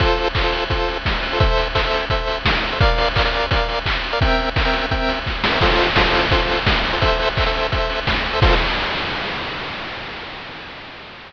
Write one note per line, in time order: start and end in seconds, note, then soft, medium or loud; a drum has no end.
0.00 0.28 F4 medium
0.00 0.28 A4 loud
0.00 0.28 C5 medium
0.00 kick medium
0.00 closed hi-hat loud
0.18 open hi-hat medium
0.35 0.43 F4 medium
0.35 0.43 A4 medium
0.35 0.43 C5 medium
0.35 kick medium
0.35 clap loud
0.43 0.64 F4 medium
0.43 0.64 A4 medium
0.43 0.64 C5 medium
0.52 open hi-hat medium
0.70 0.98 F4 medium
0.70 0.98 A4 medium
0.70 0.98 C5 medium
0.70 kick medium
0.70 closed hi-hat medium
0.88 open hi-hat medium
1.05 kick medium
1.05 snare medium
1.23 open hi-hat medium
1.32 1.39 F4 medium
1.32 1.39 A4 medium
1.32 1.39 C5 medium
1.40 1.68 A4 medium
1.40 1.68 C5 medium
1.40 1.68 E5 medium
1.40 kick loud
1.40 closed hi-hat medium
1.57 open hi-hat medium
1.75 1.82 A4 medium
1.75 1.82 C5 medium
1.75 1.82 E5 medium
1.75 kick medium
1.75 clap loud
1.84 2.05 A4 medium
1.84 2.05 C5 medium
1.84 2.05 E5 medium
1.93 open hi-hat medium
2.10 2.39 A4 medium
2.10 2.39 C5 medium
2.10 2.39 E5 medium
2.10 kick medium
2.10 closed hi-hat medium
2.27 open hi-hat medium
2.45 kick medium
2.45 snare loud
2.63 open hi-hat medium
2.72 2.79 A4 medium
2.72 2.79 C5 medium
2.72 2.79 E5 medium
2.80 3.09 A#4 medium
2.80 3.09 D5 medium
2.80 3.09 F5 medium
2.80 kick loud
2.80 closed hi-hat medium
2.98 open hi-hat medium
3.16 3.23 A#4 medium
3.16 3.23 D5 medium
3.16 3.23 F5 medium
3.16 kick medium
3.16 clap loud
3.25 3.46 A#4 medium
3.25 3.46 D5 medium
3.25 3.46 F5 medium
3.33 open hi-hat medium
3.51 3.79 A#4 medium
3.51 3.79 D5 medium
3.51 3.79 F5 medium
3.51 kick medium
3.51 closed hi-hat loud
3.69 open hi-hat medium
3.86 kick medium
3.86 clap loud
4.04 open hi-hat medium
4.13 4.20 A#4 medium
4.13 4.20 D5 medium
4.13 4.20 F5 medium
4.21 4.49 C4 medium
4.21 4.49 A#4 medium
4.21 4.49 E5 medium
4.21 4.49 G5 medium
4.21 kick loud
4.21 closed hi-hat loud
4.39 open hi-hat medium
4.56 4.63 C4 medium
4.56 4.63 A#4 medium
4.56 4.63 E5 medium
4.56 4.63 G5 medium
4.56 kick medium
4.56 clap loud
4.65 4.86 C4 medium
4.65 4.86 A#4 medium
4.65 4.86 E5 medium
4.65 4.86 G5 medium
4.73 open hi-hat medium
4.91 5.19 C4 medium
4.91 5.19 A#4 medium
4.91 5.19 E5 medium
4.91 5.19 G5 medium
4.91 kick medium
4.91 closed hi-hat medium
5.09 open hi-hat medium
5.26 kick medium
5.26 snare medium
5.44 snare loud
5.52 5.59 C4 medium
5.52 5.59 A#4 medium
5.52 5.59 E5 medium
5.52 5.59 G5 medium
5.61 5.90 F4 loud
5.61 5.90 A4 medium
5.61 5.90 C5 medium
5.61 kick medium
5.61 crash loud
5.79 open hi-hat medium
5.96 6.04 F4 medium
5.96 6.04 A4 medium
5.96 6.04 C5 medium
5.96 kick medium
5.96 snare loud
6.05 6.26 F4 medium
6.05 6.26 A4 medium
6.05 6.26 C5 medium
6.14 open hi-hat medium
6.31 6.60 F4 medium
6.31 6.60 A4 medium
6.31 6.60 C5 medium
6.31 kick medium
6.31 closed hi-hat loud
6.49 open hi-hat medium
6.66 kick medium
6.66 snare loud
6.85 open hi-hat medium
6.93 7.00 F4 medium
6.93 7.00 A4 medium
6.93 7.00 C5 medium
7.01 7.29 A4 medium
7.01 7.29 C5 medium
7.01 7.29 E5 medium
7.01 kick medium
7.01 closed hi-hat loud
7.19 open hi-hat medium
7.37 7.44 A4 medium
7.37 7.44 C5 medium
7.37 7.44 E5 medium
7.37 kick medium
7.37 clap medium
7.46 7.67 A4 medium
7.46 7.67 C5 medium
7.46 7.67 E5 medium
7.54 open hi-hat medium
7.72 8.00 A4 medium
7.72 8.00 C5 medium
7.72 8.00 E5 medium
7.72 kick medium
7.72 closed hi-hat medium
7.90 open hi-hat medium
8.07 kick medium
8.07 snare loud
8.25 open hi-hat medium
8.33 8.40 A4 medium
8.33 8.40 C5 medium
8.33 8.40 E5 medium
8.42 8.55 F4 loud
8.42 8.55 A4 loud
8.42 8.55 C5 loud
8.42 kick loud
8.42 crash loud